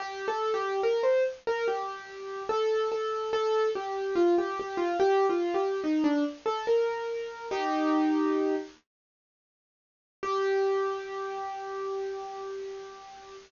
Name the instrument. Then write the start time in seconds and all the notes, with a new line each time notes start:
acoustic grand piano
0.00 G4
0.28 A4
0.54 G4
0.83 A#4
1.03 C5
1.47 A#4
1.68 G4
2.49 A4
2.92 A4
3.33 A4
3.75 G4
4.15 F4
4.38 G4
4.60 G4
4.77 F4
5.00 G4
5.30 F4
5.54 G4
5.84 D#4
6.04 D4
6.46 A4
6.67 A#4
7.51 D#4 G4
10.23 G4